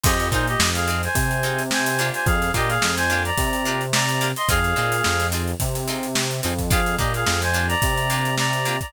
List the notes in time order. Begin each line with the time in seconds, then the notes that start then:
0.03 F2 C4 D#4 F4 G4 G#4 D#5, kick, crash
0.20 closed hi-hat
0.31 A#2 C4 D#4 F4 G#4 C5, kick, closed hi-hat
0.47 G4 D#5, closed hi-hat
0.60 F2, snare
0.74 G#4 F5, snare, closed hi-hat
0.88 C4 D#4 F4 G#4, snare, closed hi-hat
1.03 C5 G#5, snare, closed hi-hat
1.15 C3, kick, closed hi-hat
1.31 closed hi-hat
1.43 C4 D#4 F4 G#4, closed hi-hat
1.58 closed hi-hat
1.71 C5 G#5, snare
1.86 closed hi-hat
1.99 A#3 D4 F4 G4, snare, closed hi-hat
2.14 C5 G#5, closed hi-hat
2.26 F2 G#4 F5, kick, closed hi-hat
2.42 snare, closed hi-hat
2.54 A#2 A#3 D4 F4 G4 D#5, kick, closed hi-hat
2.68 G#4 F5, snare, closed hi-hat
2.82 F2, snare
2.97 C5 G#5, snare, closed hi-hat
3.10 A#3 D4 F4 G4, snare, closed hi-hat
3.25 D5 A#5, closed hi-hat
3.38 C3, kick, closed hi-hat
3.53 closed hi-hat
3.65 A#3 D4 F4 G4, closed hi-hat
3.81 closed hi-hat
3.93 D5 A#5, snare
4.09 closed hi-hat
4.21 A#3 D4 F4 G4, closed hi-hat
4.36 D#5 C6, closed hi-hat
4.48 F2 C4 D#4 F4 G#4 F5, kick, closed hi-hat
4.64 closed hi-hat
4.76 A#2 C4 D#4 F4 G#4, closed hi-hat
4.92 closed hi-hat
5.04 F2, snare
5.20 snare, closed hi-hat
5.32 C4 D#4 F4 G#4, closed hi-hat
5.47 closed hi-hat
5.60 C3, kick, closed hi-hat
5.75 closed hi-hat
5.88 C4 D#4 F4 G#4, snare, closed hi-hat
6.03 closed hi-hat
6.15 snare
6.31 closed hi-hat
6.43 F2 C4 D#4 F4 G#4, closed hi-hat
6.58 kick, closed hi-hat
6.70 A#3 D4 F4 G4 G#4 F5, kick, closed hi-hat
6.86 closed hi-hat
6.98 A#2 A#3 D4 F4 G4 D#5, kick, closed hi-hat
7.14 G#4 F5, closed hi-hat
7.26 F2, snare
7.42 C5 G#5, snare, closed hi-hat
7.53 A#3 D4 F4 G4, closed hi-hat
7.68 D5 A#5, closed hi-hat
7.82 C3, kick, closed hi-hat
7.97 closed hi-hat
8.10 A#3 D4 F4 G4, closed hi-hat
8.25 closed hi-hat
8.37 D5 A#5, snare
8.53 closed hi-hat
8.65 A#3 D4 F4 G4, closed hi-hat
8.81 D5 A#5, kick, closed hi-hat